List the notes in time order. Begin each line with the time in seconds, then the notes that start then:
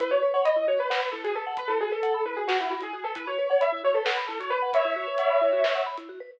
0.00 E4 B4, kick, closed hi-hat
0.11 F#4 C#5
0.22 B4
0.34 C#5 F#5
0.45 D#5 B5, closed hi-hat
0.56 E4
0.68 F#4 C#5
0.79 B4
0.90 B4 F#5, snare
1.01 B5
1.12 E4 A4
1.24 F#4 G#4, closed hi-hat
1.35 A4 B4
1.47 F#5
1.57 B4 B5, kick, closed hi-hat
1.68 E4 A4
1.80 F#4 G#4
1.92 A4 B4
2.03 F#5, closed hi-hat
2.14 B5
2.25 E4 B4
2.36 F#4 G#4
2.48 F#4 B4, snare
2.59 E4 F#5
2.70 F#4 B5
2.81 E4 G#4, closed hi-hat
2.93 F#4 G#4
3.04 A4 B4
3.15 E4 B4, kick, closed hi-hat
3.27 F#4 C#5
3.38 B4
3.50 C#5 F#5
3.61 E5 B5, closed hi-hat
3.72 E4
3.84 F#4 C#5
3.94 A4 B4
4.05 B4 F#5, snare
4.17 B5
4.27 E4 A4
4.40 F#4 C#5, closed hi-hat
4.50 B4
4.62 F#5
4.73 C#5 E5 B5, kick, closed hi-hat
4.85 E4
4.96 F#4
5.07 B4
5.18 F#5, closed hi-hat
5.30 B5
5.41 E4
5.53 F#4
5.64 B4, snare
5.75 F#5
5.86 B5
5.97 E4, closed hi-hat
6.09 F#4
6.20 B4